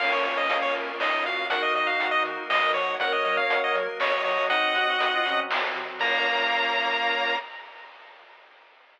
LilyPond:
<<
  \new Staff \with { instrumentName = "Lead 1 (square)" } { \time 3/4 \key bes \minor \tempo 4 = 120 f''16 des''16 des''16 ees''8 des''16 r8 ees''8 f''8 | ges''16 ees''16 ees''16 f''8 ees''16 r8 ees''8 des''8 | ges''16 ees''16 ees''16 f''8 ees''16 r8 des''8 des''8 | <ees'' ges''>2 r4 |
bes''2. | }
  \new Staff \with { instrumentName = "Clarinet" } { \time 3/4 \key bes \minor <bes des'>2 ees'16 ees'16 ges'8 | <ees' ges'>2 r16 bes'16 des''16 r16 | <bes' des''>2 ees''16 ees''16 ees''8 | ees'8 ges'16 ges'16 ges'16 f'16 des'8 r4 |
bes2. | }
  \new Staff \with { instrumentName = "Lead 1 (square)" } { \time 3/4 \key bes \minor bes'8 des''8 f''8 bes'8 des''8 f''8 | bes'8 ees''8 ges''8 bes'8 ees''8 ges''8 | bes'8 des''8 ges''8 bes'8 des''8 ges''8 | r2. |
<bes' des'' f''>2. | }
  \new Staff \with { instrumentName = "Synth Bass 1" } { \clef bass \time 3/4 \key bes \minor bes,,8 bes,8 bes,,8 bes,8 bes,,8 bes,8 | ees,8 ees8 ees,8 ees8 e8 f8 | ges,8 ges8 ges,8 ges8 ges,8 ges8 | c,8 c8 c,8 c8 c,8 c8 |
bes,,2. | }
  \new Staff \with { instrumentName = "Drawbar Organ" } { \time 3/4 \key bes \minor <bes des' f'>2. | <bes ees' ges'>2. | <bes des' ges'>4. <ges bes ges'>4. | <c' ees' ges'>4. <ges c' ges'>4. |
<bes des' f'>2. | }
  \new DrumStaff \with { instrumentName = "Drums" } \drummode { \time 3/4 <cymc bd>8 hh8 hh8 hh8 sn8 hh8 | <hh bd>8 hh8 hh8 hh8 sn8 hh8 | <hh bd>8 hh8 hh8 hh8 sn8 hho8 | <hh bd>8 hh8 hh8 hh8 sn8 hh8 |
<cymc bd>4 r4 r4 | }
>>